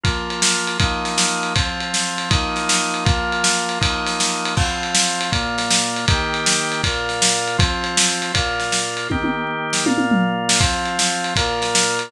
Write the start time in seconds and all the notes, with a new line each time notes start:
0.04 F3 A#3 F4, kick, ride
0.30 ride
0.42 snare
0.67 ride
0.80 F3 A#3 D#4, kick, ride
1.05 snare, ride
1.18 snare
1.43 ride
1.55 F3 C4 F4, kick, ride
1.81 ride
1.94 snare
2.18 ride
2.30 F3 A#3 D#4, kick, ride
2.56 snare, ride
2.69 snare
2.94 ride
3.05 F3 A#3 F4, kick, ride
3.32 ride
3.44 snare
3.69 ride
3.81 F3 A#3 D#4, kick, ride
4.07 snare, ride
4.20 snare
4.46 ride
4.57 F3 C4 F4, kick, crash
4.83 ride
4.95 snare
5.21 ride
5.32 A#2 A#3 F4, kick, ride
5.58 snare, ride
5.71 snare
5.96 ride
6.08 D#3 A#3 G4, kick, ride
6.34 ride
6.46 snare
6.72 ride
6.83 A#2 A#3 F4, kick, ride
7.09 snare, ride
7.22 snare
7.48 ride
7.58 F3 C4 F4, kick, ride
7.84 ride
7.97 snare
8.22 ride
8.34 A#2 A#3 F4, kick, ride
8.60 snare, ride
8.72 snare
8.97 ride
9.10 D#3 A#3 G4, kick, high tom
9.24 high tom
9.73 snare
9.86 A#2 A#3 F4, high tom
9.98 high tom
10.11 mid tom
10.49 snare
10.60 F3 C4 F4, kick, ride
10.86 ride
10.99 snare
11.24 ride
11.36 A#2 A#3 F4, kick, ride
11.62 snare, ride
11.75 snare
11.99 ride